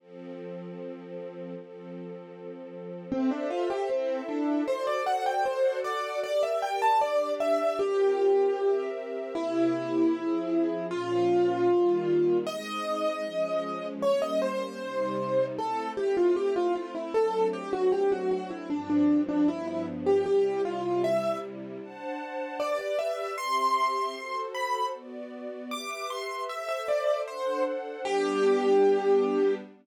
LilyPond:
<<
  \new Staff \with { instrumentName = "Acoustic Grand Piano" } { \time 2/4 \key f \major \tempo 4 = 77 r2 | r2 | c'16 d'16 f'16 g'16 c'8 d'8 | c''16 d''16 fis''16 g''16 c''8 d''8 |
d''16 e''16 g''16 a''16 d''8 e''8 | g'4. r8 | \key f \minor e'2 | f'2 |
ees''2 | des''16 ees''16 c''4. | \key f \major a'8 g'16 f'16 g'16 f'16 f'16 e'16 | a'8 g'16 fis'16 g'16 fis'16 fis'16 e'16 |
d'16 d'8 d'16 e'16 e'16 r16 g'16 | g'8 f'8 e''8 r8 | \key g \major r4 d''16 d''16 e''8 | c'''4. b''8 |
r4 d'''16 d'''16 c'''8 | e''16 e''16 d''8 c''8 r8 | g'2 | }
  \new Staff \with { instrumentName = "String Ensemble 1" } { \time 2/4 \key f \major <f c' a'>2 | <f c' a'>2 | <a' c'' e''>4 <e' a' e''>4 | <fis' a' c'' d''>4 <fis' a' d'' fis''>4 |
<g' bes' d''>4 <d' g' d''>4 | <c' f' g' bes'>4 <c' g' bes' e''>4 | \key f \minor <c bes e' g'>4 <f c' aes'>4 | <bes, f des'>4 <ees g bes>4 |
<aes c' ees'>4 <f aes des'>4 | <g bes des'>4 <c g ees'>4 | \key f \major <a c' e'>2 | <fis a c' d'>2 |
<g, f c' d'>4 <g, f b d'>4 | <c g e'>2 | \key g \major <d' c'' fis'' a''>4 <g' b' d''>4 | <c' g' e''>4 <fis' a' c''>4 |
<b fis' d''>4 <g' b' e''>4 | <a' c'' e''>4 <d' a' c'' fis''>4 | <g b d'>2 | }
>>